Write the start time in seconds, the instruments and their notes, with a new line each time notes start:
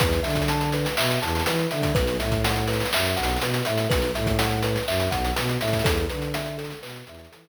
0.00 violin E2, kalimba B4, kick, closed hi-hat
0.12 snare, closed hi-hat
0.23 violin D3, kalimba E5, closed hi-hat
0.30 closed hi-hat
0.35 kick, closed hi-hat
0.42 closed hi-hat
0.48 kalimba A5, closed hi-hat
0.61 closed hi-hat
0.72 kalimba B4, closed hi-hat
0.85 snare, closed hi-hat
0.97 violin B2, kalimba E5, clap
1.11 closed hi-hat
1.22 violin E2, kalimba A5, closed hi-hat
1.28 closed hi-hat
1.35 closed hi-hat
1.40 closed hi-hat
1.46 violin E3, kalimba B4, closed hi-hat
1.59 closed hi-hat
1.71 violin D3, kalimba E5, closed hi-hat
1.82 kick, closed hi-hat
1.95 violin B1, kalimba B4, kick, closed hi-hat
2.07 closed hi-hat
2.20 violin A2, kalimba E5, closed hi-hat
2.31 kick, closed hi-hat
2.44 kalimba F#5, closed hi-hat
2.56 closed hi-hat
2.67 kalimba B4, closed hi-hat
2.73 closed hi-hat
2.80 snare, closed hi-hat
2.85 closed hi-hat
2.93 violin F#2, kalimba E5, clap
3.05 closed hi-hat
3.17 violin B1, kalimba F#5, closed hi-hat
3.23 closed hi-hat
3.28 snare, closed hi-hat
3.36 closed hi-hat
3.41 violin B2, kalimba B4, closed hi-hat
3.54 closed hi-hat
3.65 violin A2, kalimba E5, closed hi-hat
3.78 closed hi-hat
3.90 violin B1, kalimba B4, kick, closed hi-hat
4.02 closed hi-hat
4.15 violin A2, kalimba E5, closed hi-hat
4.26 kick, closed hi-hat
4.39 kalimba F#5, closed hi-hat
4.51 closed hi-hat
4.63 kalimba B4, closed hi-hat
4.76 snare, closed hi-hat
4.88 violin F#2, kalimba E5, clap
5.00 closed hi-hat
5.11 violin B1, kalimba F#5, kick, closed hi-hat
5.24 closed hi-hat
5.36 violin B2, kalimba B4, closed hi-hat
5.49 closed hi-hat
5.60 violin A2, kalimba E5, closed hi-hat
5.68 closed hi-hat
5.73 kick, closed hi-hat
5.79 closed hi-hat
5.84 violin E2, kalimba A4, kick, closed hi-hat
5.97 closed hi-hat
6.09 violin D3, kalimba B4, closed hi-hat
6.22 closed hi-hat
6.34 kalimba E5, closed hi-hat
6.46 closed hi-hat
6.58 kalimba A4, closed hi-hat
6.64 closed hi-hat
6.70 snare, closed hi-hat
6.82 violin B2, kalimba B4, clap
6.89 closed hi-hat
6.96 closed hi-hat
7.07 violin E2, kalimba E5, closed hi-hat
7.15 closed hi-hat
7.19 closed hi-hat
7.25 closed hi-hat
7.31 violin E3, kalimba A4, closed hi-hat
7.44 snare, closed hi-hat